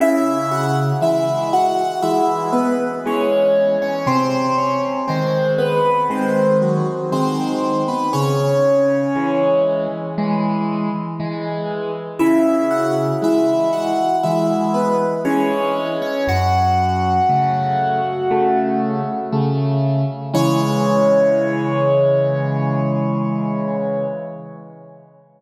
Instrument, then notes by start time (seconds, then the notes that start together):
acoustic grand piano
0.00 C#3 E4 E5
0.51 F#4 F#5
1.01 E3 G#3 E4 E5
1.53 F#4 F#5
2.03 E3 G#3 E4 E5
2.53 B3 B4
3.06 E3 G#3 C#4 C#5
3.82 C#4 C#5
4.06 C3 C4 C5
4.58 C#4 C#5
5.08 D#3 G#3 C4 C5
5.58 B3 B4
6.10 D#3 G#3 C4 C5
6.62 F#3 F#4
7.12 D#3 G#3 C4 C5
7.88 B3 B4
8.13 C#3 C#4 C#5
9.16 E3 G#3
10.18 E3 G#3
11.20 E3 G#3
12.19 C#3 E4 E5
12.71 F#4 F#5
13.22 E3 G#3 E4 E5
13.73 F#4 F#5
14.23 E3 G#3 E4 E5
14.74 B3 B4
15.25 E3 G#3 C#4 C#5
16.02 C#4 C#5
16.28 F#2 F#4 F#5
17.29 C#3 A3
18.31 C#3 A3
19.32 C#3 A3
20.33 C#3 E3 G#3 C#5